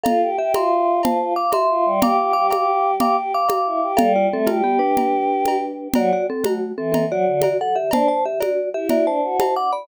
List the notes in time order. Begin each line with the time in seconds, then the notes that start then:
0.04 F4 A4 F5, cowbell, low conga
0.22 G4
0.38 G4 E5
0.54 F4 E5 C6, cowbell, high conga
1.03 F4 C5 A5, cowbell, low conga
1.20 F4
1.36 F5 D6
1.52 E5 C6, cowbell, high conga
1.69 F4
1.85 G3
2.02 G4 F5 D6, cowbell, low conga
2.18 G4
2.33 G4 F5 D6
2.50 G4 F5 D6, cowbell, high conga
3.00 G4 F5 D6, cowbell, low conga
3.17 G4
3.34 F5 D6
3.49 F5 D6, cowbell, high conga
3.66 E4
3.82 G4
3.97 G3 A4 F5, cowbell, low conga
4.16 F4 D5
4.31 A3 C4 A4
4.47 A3 F4 G4, cowbell, high conga
4.64 B3 G4
4.79 D4 B4
4.97 cowbell, low conga
5.46 cowbell, high conga
5.94 F#3 F#4 D5, cowbell, low conga
6.13 F#4 D5
6.30 C4 A4
6.44 A3 F#4, cowbell, high conga
6.77 E3 C4 A4
6.92 C4 A4, cowbell, low conga
7.10 F#3 F#4 D5
7.27 D3
7.42 F#4 D5, cowbell, high conga
7.61 A4 F#5
7.76 G4 E5
7.91 D4 C5 A5, cowbell, low conga
8.08 C5 A5
8.25 G4 E5
8.40 F#4 D5, cowbell, high conga
8.74 E4 G4 E5
8.89 F#4 D5, cowbell, low conga
9.06 D4 C5 A5
9.23 F#4
9.40 C5 A5, cowbell, high conga
9.56 F#5 D6
9.73 D5 B5